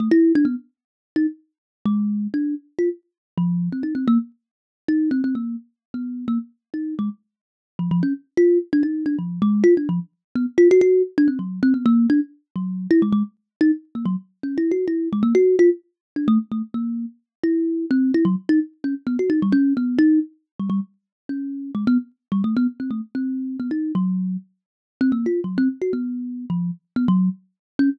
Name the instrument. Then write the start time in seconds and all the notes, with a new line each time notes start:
kalimba
0.00 A3
0.11 E4
0.35 D4
0.45 B3
1.16 D#4
1.85 G#3
2.34 D4
2.79 F4
3.37 F3
3.72 C4
3.83 D#4
3.95 C4
4.08 A#3
4.88 D#4
5.11 C4
5.24 C4
5.35 A#3
5.94 B3
6.28 A#3
6.74 D#4
6.99 G#3
7.79 F3
7.91 F3
8.03 C#4
8.37 F4
8.73 D4
8.83 D#4
9.06 D4
9.19 F3
9.42 G#3
9.64 F4
9.77 D4
9.89 F3
10.35 B3
10.58 F4
10.71 F#4
10.81 F#4
11.18 D4
11.28 C4
11.39 F#3
11.63 C4
11.74 B3
11.86 A#3
12.10 D4
12.56 F#3
12.91 E4
13.02 G#3
13.12 G#3
13.61 D#4
13.95 A#3
14.06 F#3
14.43 C#4
14.58 E4
14.71 F#4
14.88 E4
15.13 G#3
15.23 A#3
15.35 F#4
15.59 F4
16.16 D4
16.28 A3
16.52 A3
16.74 A#3
17.44 E4
17.91 C4
18.14 E4
18.25 F#3
18.49 D#4
18.84 C#4
19.07 B3
19.19 F#4
19.30 D#4
19.42 G3
19.52 C#4
19.77 B3
19.99 D#4
20.59 G3
20.70 G3
21.29 C#4
21.75 G#3
21.87 B3
22.32 G3
22.44 A3
22.57 B3
22.80 C4
22.91 A3
23.15 C4
23.60 B3
23.71 D#4
23.95 F#3
25.01 C4
25.12 A#3
25.26 F4
25.44 F#3
25.58 C4
25.82 F#4
25.93 B3
26.50 F3
26.96 B3
27.08 F#3
27.79 C#4